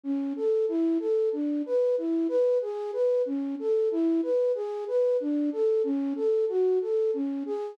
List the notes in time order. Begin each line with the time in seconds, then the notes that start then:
0.03 C#4
0.36 A4
0.68 E4
1.00 A4
1.33 D4
1.66 B4
1.98 E4
2.28 B4
2.62 G#4
2.93 B4
3.26 C#4
3.59 A4
3.91 E4
4.23 B4
4.55 G#4
4.87 B4
5.20 D4
5.53 A4
5.84 C#4
6.16 A4
6.49 F#4
6.81 A4
7.14 C#4
7.46 G#4